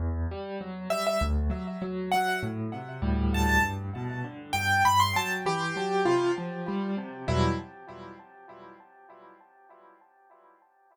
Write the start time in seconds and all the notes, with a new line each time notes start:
0.00 E2
0.31 G3
0.61 F#3
0.90 G3 E5
1.07 E5
1.21 D2
1.50 F#3
1.82 F#3
2.11 F#3 F#5
2.43 A2
2.74 C3
3.02 D2 A2 G3
3.34 A5
3.49 A5
3.63 G2
3.96 B2
4.24 D3
4.53 G2 G5
4.85 G2 B5
5.00 C6
5.16 F#3 A5
5.46 E3 G4
5.76 F#3
6.05 C3 F4
6.38 F3
6.68 G3
6.97 C3
7.28 E2 B2 F#3 G3 E4